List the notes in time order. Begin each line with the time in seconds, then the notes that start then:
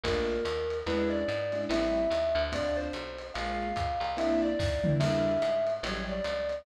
0.04 A#1 A3 A#3 D4 F4 A#4, kick, ride
0.45 D#2, hi-hat pedal, ride
0.70 ride
0.86 E2 G#3 C#4 D4 E4 B4, ride
1.10 D5
1.28 G#2, hi-hat pedal, ride
1.52 G#3 C#4 D4 E4, ride
1.69 A1 G3 A3 C4 E4 E5, ride
2.10 D#2, hi-hat pedal, ride
2.35 D2, ride
2.52 A3 C4 D4 F4 D5, kick, ride
2.77 C5
2.93 B1, hi-hat pedal, ride
3.19 ride
3.34 A#1 G#3 A#3 C#4 F4 F5, ride
3.76 C#2, kick, hi-hat pedal, ride
4.00 C2, ride
4.17 A#3 C4 D4 E4 E5, ride
4.42 D5
4.59 D#2, kick, snare
4.84 A#3 C4 D4 E4, mid tom
5.00 E2 G3 A#3 D4 E4 E5, crash, ride
5.42 G#2, hi-hat pedal, ride
5.67 ride
5.83 A1 F#3 G3 A3 C#4 C#5, ride
6.08 D5
6.24 C#2, hi-hat pedal, ride
6.49 ride